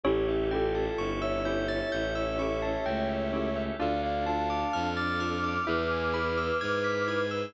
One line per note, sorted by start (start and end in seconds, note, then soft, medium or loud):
0.04 0.88 A1 loud
0.04 0.21 C#4 loud
0.04 3.77 C#4 medium
0.04 0.26 E4 medium
0.04 3.77 E4 medium
0.04 0.21 E4 medium
0.04 0.86 G4 loud
0.04 0.26 G4 loud
0.04 3.77 G4 medium
0.04 0.21 G4 medium
0.04 3.77 A4 medium
0.04 0.26 C#5 medium
0.09 0.21 A4 medium
0.27 0.49 E4 loud
0.27 0.49 G4 loud
0.27 0.49 E5 medium
0.51 0.84 C#4 medium
0.51 0.84 E4 medium
0.51 1.09 F4 medium
0.51 0.84 G4 medium
0.51 1.09 A4 medium
0.51 0.72 G5 medium
0.55 0.84 A4 medium
0.75 0.96 A5 medium
0.97 1.81 G1 loud
0.97 2.65 E4 medium
0.97 1.19 C#6 medium
1.21 3.63 C#5 medium
1.21 3.63 E5 medium
1.21 1.43 E6 medium
1.45 1.78 C#4 medium
1.45 1.78 E4 medium
1.45 1.78 G4 medium
1.45 1.78 A4 medium
1.45 1.66 G6 medium
1.68 1.89 A6 medium
1.92 2.77 A1 medium
1.92 2.13 G6 medium
2.15 2.36 E6 medium
2.39 2.72 C#4 medium
2.39 2.72 E4 medium
2.39 2.72 G4 medium
2.39 2.72 A4 medium
2.39 2.60 C#6 medium
2.62 2.83 A5 medium
2.85 3.70 C#2 medium
2.85 3.71 A3 medium
2.85 3.07 G5 medium
3.09 3.30 E5 medium
3.33 3.49 C#4 medium
3.33 3.49 E4 medium
3.33 3.49 G4 medium
3.33 3.49 A4 medium
3.33 3.54 C#5 medium
3.56 3.77 E5 medium
3.79 4.64 D2 loud
3.79 5.59 D4 medium
3.79 3.96 D4 medium
3.79 5.65 D4 medium
3.79 5.65 F4 medium
3.79 3.96 F4 medium
3.79 5.65 A4 medium
3.79 3.96 A4 loud
3.79 4.01 D5 medium
3.79 4.01 F5 loud
4.03 4.25 D5 medium
4.03 4.25 F5 medium
4.03 4.24 F5 medium
4.26 4.59 D4 medium
4.26 4.59 F4 medium
4.26 4.59 A4 medium
4.26 4.89 F5 medium
4.26 4.47 A5 medium
4.26 4.89 A5 loud
4.50 4.71 D6 medium
4.73 5.58 F2 loud
4.73 4.94 F6 medium
4.96 7.20 D6 medium
4.96 7.20 F6 medium
4.96 5.18 A6 medium
5.20 5.37 D4 medium
5.20 5.37 F4 medium
5.20 5.37 A4 medium
5.20 5.41 F6 medium
5.44 5.65 D6 medium
5.66 6.51 E2 loud
5.66 5.83 E4 medium
5.66 7.53 E4 medium
5.66 7.53 G#4 medium
5.66 5.83 G#4 medium
5.66 6.58 B4 medium
5.66 7.53 B4 medium
5.66 5.83 B4 medium
5.66 5.88 E5 medium
5.90 6.12 G#5 medium
6.14 6.47 E4 medium
6.14 6.47 G#4 medium
6.14 6.47 B4 medium
6.14 6.35 B5 medium
6.37 6.58 E6 medium
6.61 7.45 G#2 loud
6.61 7.43 B4 medium
6.61 6.82 G#6 medium
6.84 7.05 B6 medium
7.08 7.24 E4 medium
7.08 7.24 G#4 medium
7.08 7.24 B4 medium
7.08 7.29 G#6 medium
7.31 7.52 E6 medium